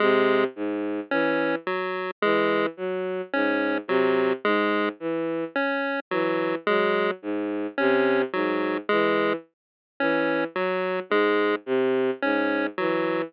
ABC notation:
X:1
M:3/4
L:1/8
Q:1/4=54
K:none
V:1 name="Violin" clef=bass
C, ^G,, E, z E, ^F, | ^G,, C, G,, E, z E, | ^F, ^G,, C, G,, E, z | E, ^F, ^G,, C, G,, E, |]
V:2 name="Lead 1 (square)"
^G, z ^C ^F, G, z | ^C ^F, ^G, z C F, | ^G, z ^C ^F, G, z | ^C ^F, ^G, z C F, |]